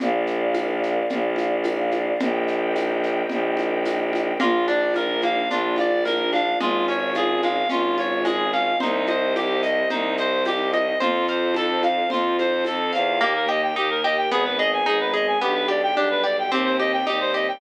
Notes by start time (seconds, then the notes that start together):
0.00 A#1 A#4 D5 F5, low conga, shaker
0.27 shaker
0.54 tambourine, high conga, shaker
0.83 shaker
1.10 A#1, low conga, shaker
1.36 high conga, shaker
1.63 tambourine, high conga, shaker
1.91 high conga, shaker
2.20 A#1 A#4 D#5 G5, low conga, shaker
2.47 shaker
2.76 tambourine, high conga, shaker
3.03 shaker
3.29 A#1, low conga, shaker
3.57 high conga, shaker
3.85 tambourine, high conga, shaker
4.13 high conga, shaker
4.40 A#1 A#3 D4 F4, low conga, shaker
4.68 D4 D5, high conga, shaker
4.94 F4 A#4, tambourine, high conga, shaker
5.21 A#3 F5, high conga, shaker
5.50 A#1 D4 F4, low conga, shaker
5.76 F4 D5, high conga, shaker
6.05 A#3 A#4, tambourine, high conga, shaker
6.33 D4 F5, high conga, shaker
6.60 G#1 G#3 C#4 F4, low conga, shaker
6.88 C#4 C#5, high conga, shaker
7.15 F4 G#4, tambourine, high conga, shaker
7.42 G#3 F5, high conga, shaker
7.69 G#1 C#4 F4, low conga, shaker
7.98 F4 C#5, high conga, shaker
8.25 G#3 G#4, tambourine, high conga, shaker
8.53 C#4 F5, shaker
8.80 C2 D#4 G4 C5 D#5, low conga, shaker
9.07 C5 D#5, high conga, shaker
9.35 G4 G5, tambourine, high conga, shaker
9.63 D#5, shaker
9.90 C2 D#4 C5, low conga, shaker
10.17 C5 D#5, shaker
10.45 G4 G5, tambourine, high conga, shaker
10.73 D#5, high conga, shaker
11.00 F2 F4 A4 C5, low conga, shaker
11.27 C5 F5, shaker
11.54 A4 A5, tambourine, high conga, shaker
11.83 F5, high conga, shaker
12.10 F2 F4 C5, low conga, shaker
12.39 C5 F5, high conga, shaker
12.65 F2 A4 A5, tambourine, high conga, shaker
12.93 E2 F5, shaker
13.21 D#2 A#3 D#4 G4
13.36 A#4
13.49 G4 D#5
13.63 G5
13.76 D#2 A#3 D#4 G4 A#4
13.90 A#4
14.04 G4 D#5
14.17 G5
14.31 G#1 B3 D#4 G#4
14.45 B4
14.58 G#4 D#5
14.73 G#5
14.85 G#1 G#3 B3 D#4 G#4
15.00 B4
15.14 G#4 D#5
15.27 G#5
15.41 B1 B3 D4 G4
15.54 B4
15.68 G4 D5
15.82 G5
15.95 B1 G3 B3 D4 G4
16.10 B4
16.24 G4 D5
16.38 G5
16.51 D#2 C4 D#4 G4
16.65 C5
16.79 G4 D#5
16.92 G5
17.06 D#2 G3 C4 D#4 G4
17.20 C5
17.34 G4 D#5
17.48 G5